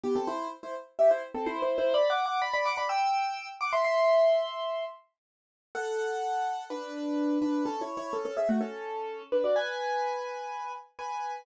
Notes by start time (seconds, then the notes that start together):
0.03 B3 G4
0.15 C4 A4
0.27 E4 C5
0.63 E4 C5
0.99 G4 E5
1.11 E4 C5
1.34 C4 A4
1.46 E4 C5
1.62 E4 C5
1.78 E4 C5
1.94 D5 B5
2.10 F#5 D6
2.26 F#5 D6
2.42 D5 B5
2.53 D5 B5
2.65 F#5 D6
2.77 D5 B5
2.89 G5 E6
3.61 F#5 D6
3.73 E5 C6
3.84 E5 C6
5.75 A4 F#5
6.70 D4 B4
7.42 D4 B4
7.65 C#4 A4
7.81 E4 C#5
7.97 E4 C#5
8.13 C#4 A4
8.25 C#4 A4
8.37 G#4 E5
8.49 A3 F#4
8.61 C#4 A4
9.32 D4 B4
9.44 F#4 D5
9.56 B4 G#5
10.99 B4 G#5